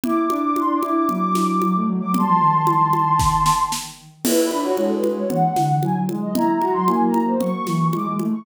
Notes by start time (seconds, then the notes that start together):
0.04 E4 D6, low conga
0.22 D6
0.30 D4, high conga
0.37 D6
0.56 C6, high conga
0.74 D6
0.82 E4, high conga
0.92 D6
1.08 F#3 D6, low conga
1.35 snare, high conga
1.62 F#3 D6, high conga
1.75 A3
1.88 F#3
2.00 F#3 D6
2.14 G3 A5 C6, low conga
2.28 F3
2.40 D#3
2.67 high conga
2.93 high conga
3.20 kick, snare
3.46 snare
3.72 snare
4.24 E4 B4, crash, low conga
4.44 B5
4.51 D4, high conga
4.60 F#4 C#5
4.77 G#3 A4, high conga
4.95 B4
5.04 high conga
5.13 C#5
5.29 E3 F#5, low conga
5.56 D3, snare, high conga
5.82 F#3 G#5, high conga
5.96 F#3
6.09 G#3, high conga
6.21 D#5
6.34 E4 A#5, low conga
6.54 A#5
6.61 F#4, high conga
6.72 F#3 C6
6.87 A#3 G#5, high conga
7.06 A#5
7.14 high conga
7.24 C5
7.40 F#3 C#6, low conga
7.67 E3, snare, high conga
7.93 G#3 D6, high conga
8.05 G#3
8.19 A3, high conga
8.33 C#6